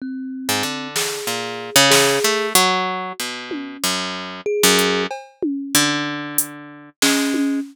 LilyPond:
<<
  \new Staff \with { instrumentName = "Orchestral Harp" } { \time 4/4 \tempo 4 = 94 r8. gis,16 d4 ais,8. cis8. a8 | fis4 b,4 fis,4 r16 fis,8. | r4 d2 gis4 | }
  \new Staff \with { instrumentName = "Kalimba" } { \time 4/4 c'4. gis'4. gis'4 | fis'4 r2 gis'4 | r2. cis'4 | }
  \new DrumStaff \with { instrumentName = "Drums" } \drummode { \time 4/4 r4 r8 sn8 r4 sn4 | hh4 r8 tommh8 r4 r8 hh8 | cb8 tommh8 r4 hh4 sn8 tommh8 | }
>>